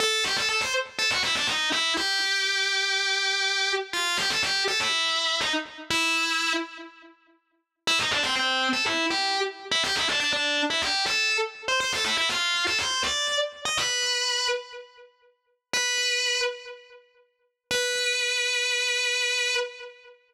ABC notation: X:1
M:4/4
L:1/16
Q:1/4=122
K:Am
V:1 name="Distortion Guitar"
A2 G A A c z2 A ^F E D ^D2 E2 | G16 | F2 G A G2 A E5 ^D z3 | E6 z10 |
E _E D C C3 A =E2 G3 z2 E | G E D D D3 E G2 A3 z2 c | c A E E F3 A c2 d3 z2 _e | B6 z10 |
[K:Bm] B6 z10 | B16 |]